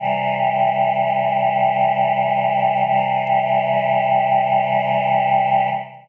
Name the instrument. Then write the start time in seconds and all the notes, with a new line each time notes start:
choir aahs
0.00 C3 E3 G3
2.86 C3 E3 G3